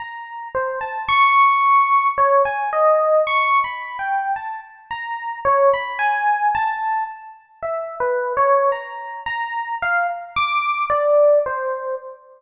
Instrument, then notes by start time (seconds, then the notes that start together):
electric piano 1
0.00 A#5
0.55 C5
0.81 A5
1.08 C#6
2.18 C#5
2.45 G#5
2.73 D#5
3.27 C#6
3.64 B5
3.99 G5
4.36 A5
4.91 A#5
5.45 C#5
5.74 B5
5.99 G#5
6.55 A5
7.62 E5
8.00 B4
8.37 C#5
8.72 A#5
9.26 A#5
9.82 F5
10.36 D6
10.90 D5
11.46 C5